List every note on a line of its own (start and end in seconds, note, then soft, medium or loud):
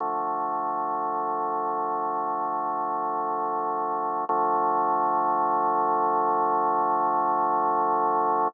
0.00 4.25 D3 medium
0.00 4.25 F3 medium
0.00 4.25 A3 medium
4.29 8.48 D3 loud
4.29 8.48 F3 loud
4.29 8.48 A3 loud